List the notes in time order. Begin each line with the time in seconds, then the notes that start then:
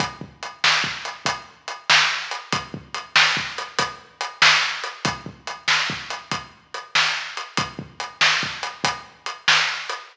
0.00 kick, closed hi-hat
0.21 kick
0.43 closed hi-hat
0.64 snare
0.84 kick
1.05 closed hi-hat
1.26 kick, closed hi-hat
1.68 closed hi-hat
1.90 snare
2.31 closed hi-hat
2.53 kick, closed hi-hat
2.74 kick
2.94 closed hi-hat
3.16 snare
3.37 kick
3.58 closed hi-hat
3.79 kick, closed hi-hat
4.21 closed hi-hat
4.42 snare
4.84 closed hi-hat
5.05 kick, closed hi-hat
5.26 kick
5.47 closed hi-hat
5.68 snare
5.90 kick
6.10 closed hi-hat
6.31 kick, closed hi-hat
6.74 closed hi-hat
6.95 snare
7.37 closed hi-hat
7.57 kick, closed hi-hat
7.79 kick
8.00 closed hi-hat
8.21 snare
8.43 kick
8.63 closed hi-hat
8.84 kick, closed hi-hat
9.26 closed hi-hat
9.48 snare
9.89 closed hi-hat